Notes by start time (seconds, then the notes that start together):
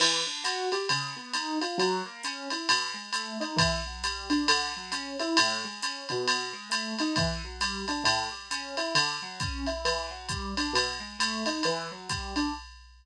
0.00 E3, crash, ride
0.27 D4
0.44 F#4, hi-hat pedal, ride
0.72 G4, ride
0.89 C#3, ride
1.17 B3
1.33 D#4, hi-hat pedal, ride
1.61 F4, ride
1.78 F#3, ride
2.05 A#3
2.23 C#4, hi-hat pedal, ride
2.50 E4, ride
2.69 B2, ride
2.94 G#3
3.13 A3, hi-hat pedal, ride
3.40 D#4, ride
3.56 E3, kick, ride
3.87 F#3
4.04 G3, hi-hat pedal, ride
4.30 D4, ride
4.48 D3, ride
4.77 F#3
4.92 C#4, hi-hat pedal, ride
5.19 E4, ride
5.37 A2, ride
5.64 G#3
5.82 C#4, hi-hat pedal, ride
6.09 B2, ride
6.28 ride
6.53 G#3
6.70 A3, hi-hat pedal, ride
6.99 D#4, ride
7.16 E3, kick, ride
7.44 F#3
7.61 G3, hi-hat pedal, ride
7.88 D4, ride
8.04 A2, ride
8.31 G3
8.51 C#4, hi-hat pedal, ride
8.77 E4, ride
8.95 D3, ride
9.22 F#3
9.40 C#4, kick, hi-hat pedal, ride
9.66 E4, ride
9.85 E3, ride
10.10 F#3
10.29 G3, kick, hi-hat pedal, ride
10.57 D4, ride
10.73 B2, ride
11.00 G#3
11.19 A3, hi-hat pedal, ride
11.46 D#4, ride
11.63 E3, ride
11.91 F#3
12.09 G3, kick, hi-hat pedal, ride
12.36 D4, ride